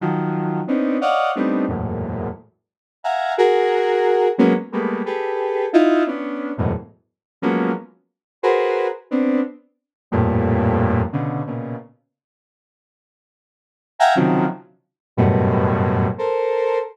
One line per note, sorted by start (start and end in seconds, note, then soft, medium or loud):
0.00 0.61 D#3 medium
0.00 0.61 F3 medium
0.00 0.61 F#3 medium
0.67 0.97 B3 medium
0.67 0.97 C4 medium
0.67 0.97 C#4 medium
0.67 0.97 D4 medium
0.67 0.97 D#4 medium
1.01 1.31 C#5 medium
1.01 1.31 D5 medium
1.01 1.31 D#5 medium
1.01 1.31 F5 medium
1.01 1.31 F#5 medium
1.35 1.66 G3 medium
1.35 1.66 A3 medium
1.35 1.66 B3 medium
1.35 1.66 C4 medium
1.35 1.66 D4 medium
1.35 1.66 D#4 medium
1.68 2.29 E2 soft
1.68 2.29 F#2 soft
1.68 2.29 G#2 soft
1.68 2.29 A2 soft
1.68 2.29 A#2 soft
3.03 3.33 E5 medium
3.03 3.33 F5 medium
3.03 3.33 F#5 medium
3.03 3.33 G#5 medium
3.03 3.33 A#5 medium
3.37 4.28 F#4 loud
3.37 4.28 G#4 loud
3.37 4.28 A#4 loud
4.38 4.53 F#3 loud
4.38 4.53 G#3 loud
4.38 4.53 A#3 loud
4.38 4.53 B3 loud
4.38 4.53 C#4 loud
4.72 5.02 G3 medium
4.72 5.02 G#3 medium
4.72 5.02 A3 medium
4.72 5.02 A#3 medium
4.72 5.02 B3 medium
5.05 5.66 G4 medium
5.05 5.66 G#4 medium
5.05 5.66 A4 medium
5.05 5.66 B4 medium
5.73 6.03 D#4 loud
5.73 6.03 E4 loud
5.73 6.03 F4 loud
6.06 6.52 B3 medium
6.06 6.52 C#4 medium
6.06 6.52 D4 medium
6.57 6.72 E2 medium
6.57 6.72 F#2 medium
6.57 6.72 G#2 medium
6.57 6.72 A2 medium
6.57 6.72 B2 medium
7.42 7.72 F3 medium
7.42 7.72 F#3 medium
7.42 7.72 G#3 medium
7.42 7.72 A#3 medium
7.42 7.72 B3 medium
7.42 7.72 C#4 medium
8.42 8.88 F#4 medium
8.42 8.88 G#4 medium
8.42 8.88 A#4 medium
8.42 8.88 B4 medium
8.42 8.88 C5 medium
9.10 9.40 B3 medium
9.10 9.40 C4 medium
9.10 9.40 D4 medium
10.11 11.02 F2 loud
10.11 11.02 G2 loud
10.11 11.02 A2 loud
10.11 11.02 A#2 loud
11.12 11.42 B2 medium
11.12 11.42 C#3 medium
11.12 11.42 D3 medium
11.46 11.76 A#2 medium
11.46 11.76 B2 medium
11.46 11.76 C#3 medium
13.99 14.14 E5 loud
13.99 14.14 F5 loud
13.99 14.14 F#5 loud
13.99 14.14 G5 loud
13.99 14.14 G#5 loud
13.99 14.14 A#5 loud
14.15 14.46 C3 medium
14.15 14.46 C#3 medium
14.15 14.46 D#3 medium
14.15 14.46 F3 medium
14.15 14.46 F#3 medium
15.17 16.08 F#2 loud
15.17 16.08 G2 loud
15.17 16.08 A2 loud
15.17 16.08 B2 loud
16.18 16.79 A4 medium
16.18 16.79 A#4 medium
16.18 16.79 C5 medium